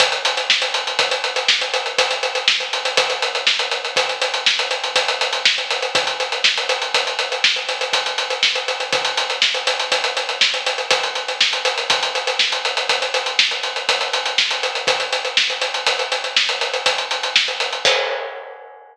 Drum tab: CC |------------------------|------------------------|------------------------|------------------------|
HH |xxxx-xxxxxxx-xxxxxxx-xxx|xxxx-xxxxxxx-xxxxxxx-xxx|xxxx-xxxxxxx-xxxxxxx-xxx|xxxx-xxxxxxx-xxxxxxx-xxx|
SD |----o-------o-------o---|----o-------o-------o---|----o-------o-------o---|----o-------o-------o---|
BD |o-------o-------o-------|o-------o-------o-------|o-------o-------o-------|o-------o-------o-------|

CC |------------------------|------------------------|x-----------------------|
HH |xxxx-xxxxxxx-xxxxxxx-xxx|xxxx-xxxxxxx-xxxxxxx-xxx|------------------------|
SD |----o-------o-------o---|----o-------o-------o---|------------------------|
BD |o-------o-------o-------|o-------o-------o-------|o-----------------------|